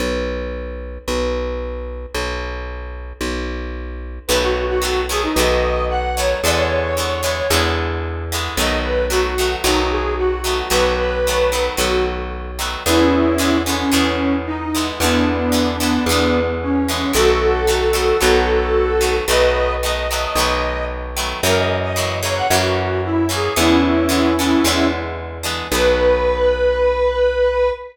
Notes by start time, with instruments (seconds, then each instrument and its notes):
0.00 electric bass (finger) B1
1.08 electric bass (finger) B1
2.15 electric bass (finger) B1
3.21 electric bass (finger) B1
4.28 electric bass (finger) B1, acoustic guitar (steel) D#3 F#3 A3, lead 1 (square) B4
4.32 acoustic guitar (steel) B3
4.42 lead 1 (square) F#4
4.69 lead 1 (square) F#4
4.82 acoustic guitar (steel) D#3 F#3 A3 B3
5.09 acoustic guitar (steel) D#3 F#3 A3 B3, lead 1 (square) G#4
5.23 lead 1 (square) D#4
5.35 electric bass (finger) B1, acoustic guitar (steel) D#3 F#3 A3, lead 1 (square) D#5
5.40 acoustic guitar (steel) B3
5.89 lead 1 (square) F#5
6.16 acoustic guitar (steel) D#3 F#3 A3, lead 1 (square) C#5
6.20 acoustic guitar (steel) B3
6.43 electric bass (finger) E2, acoustic guitar (steel) D3 E3 G#3, lead 1 (square) D5
6.48 acoustic guitar (steel) B3
6.56 lead 1 (square) C#5
6.97 acoustic guitar (steel) D3 E3 G#3 B3
7.23 acoustic guitar (steel) D3 E3 G#3 B3
7.50 electric bass (finger) E2, acoustic guitar (steel) D3 E3 G#3 B3
8.32 acoustic guitar (steel) D3 E3 G#3 B3
8.57 electric bass (finger) B1, acoustic guitar (steel) D#3 F#3 A3 B3, lead 1 (square) D#5
8.83 lead 1 (square) B4
9.09 acoustic guitar (steel) D#3 F#3 A3 B3, lead 1 (square) F#4
9.38 acoustic guitar (steel) D#3 F#3 A3 B3
9.64 electric bass (finger) B1, acoustic guitar (steel) D#3 F#3 A3 B3, lead 1 (square) D#4
9.91 lead 1 (square) G#4
10.17 lead 1 (square) F#4
10.44 acoustic guitar (steel) D#3 F#3 A3 B3
10.70 electric bass (finger) B1, acoustic guitar (steel) D#3 F#3 A3 B3, lead 1 (square) B4
10.99 lead 1 (square) B4
11.27 acoustic guitar (steel) D#3 F#3 A3 B3
11.52 acoustic guitar (steel) D#3 F#3 A3 B3
11.77 electric bass (finger) B1, acoustic guitar (steel) D#3 F#3 A3 B3, lead 1 (square) F#4
12.59 acoustic guitar (steel) D#3 F#3 A3 B3
12.86 electric bass (finger) E2, acoustic guitar (steel) D3 E3 G#3 B3, lead 1 (square) C#4 E4
13.38 acoustic guitar (steel) D3 E3 G#3 B3
13.66 acoustic guitar (steel) D3 E3 G#3 B3, lead 1 (square) C#4
13.92 electric bass (finger) E2, acoustic guitar (steel) D3 E3 G#3 B3
14.46 lead 1 (square) D#4
14.75 acoustic guitar (steel) D3 E3 G#3 B3
15.00 electric bass (finger) E2, acoustic guitar (steel) D3 E3 G#3, lead 1 (square) B3 D4
15.04 acoustic guitar (steel) B3
15.52 acoustic guitar (steel) D3 E3 G#3 B3
15.80 acoustic guitar (steel) D3 E3 G#3 B3
16.06 electric bass (finger) E2, acoustic guitar (steel) D3 E3
16.11 acoustic guitar (steel) G#3 B3
16.62 lead 1 (square) C#4
16.88 acoustic guitar (steel) D3 E3 G#3 B3
17.13 electric bass (finger) B1, acoustic guitar (steel) D#3 F#3 A3 B3, lead 1 (square) F#4 A4
17.67 acoustic guitar (steel) D#3 F#3 A3 B3
17.93 acoustic guitar (steel) D#3 F#3 A3 B3
18.21 electric bass (finger) B1, acoustic guitar (steel) D#3 F#3 A3 B3
19.01 acoustic guitar (steel) D#3 F#3 A3 B3
19.28 electric bass (finger) B1, acoustic guitar (steel) D#3 F#3 A3 B3, lead 1 (square) B4 D#5
19.82 acoustic guitar (steel) D#3 F#3 A3 B3, lead 1 (square) D#5
20.11 acoustic guitar (steel) D#3 F#3 A3 B3
20.35 electric bass (finger) B1, acoustic guitar (steel) D#3 F#3 A3
20.40 acoustic guitar (steel) B3
21.17 acoustic guitar (steel) D#3 F#3 A3 B3
21.43 electric bass (finger) F#2, acoustic guitar (steel) C#3 E3 F#3 A#3, lead 1 (square) A#4
21.57 lead 1 (square) D#5
21.83 lead 1 (square) D#5
21.96 acoustic guitar (steel) C#3 E3 F#3 A#3
22.22 acoustic guitar (steel) C#3 E3 F#3 A#3, lead 1 (square) C#5
22.36 lead 1 (square) F#5
22.50 electric bass (finger) F#2, acoustic guitar (steel) C#3 E3 F#3 A#3, lead 1 (square) F#4
23.04 lead 1 (square) E4
23.29 acoustic guitar (steel) C#3 E3 F#3 A#3, lead 1 (square) G#4
23.56 electric bass (finger) E2, acoustic guitar (steel) D3 E3 G#3 B3, lead 1 (square) C#4 E4
24.09 acoustic guitar (steel) D3 E3 G#3 B3
24.39 acoustic guitar (steel) D3 E3 G#3 B3
24.64 electric bass (finger) E2, acoustic guitar (steel) D3 E3 G#3 B3
25.43 acoustic guitar (steel) D3 E3 G#3 B3
25.71 electric bass (finger) B1, acoustic guitar (steel) D#3 F#3 A3, lead 1 (square) B4
25.75 acoustic guitar (steel) B3